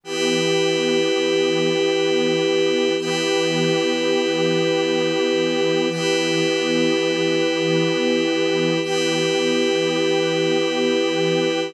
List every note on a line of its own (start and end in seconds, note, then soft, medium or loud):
0.04 2.94 E3 medium
0.04 2.94 B3 medium
0.04 2.95 E4 medium
0.04 2.94 G4 medium
0.04 2.95 G4 medium
0.04 2.95 B4 medium
2.98 5.88 E3 medium
2.98 5.88 B3 medium
2.98 5.88 E4 medium
2.98 5.88 G4 medium
2.98 5.88 G4 loud
2.98 5.88 B4 medium
5.88 8.78 E3 medium
5.88 8.78 B3 medium
5.88 8.79 E4 medium
5.88 8.78 G4 medium
5.88 8.79 G4 medium
5.88 8.79 B4 medium
8.82 11.72 E3 medium
8.82 11.72 B3 medium
8.82 11.72 E4 medium
8.82 11.72 G4 medium
8.82 11.72 G4 loud
8.82 11.72 B4 medium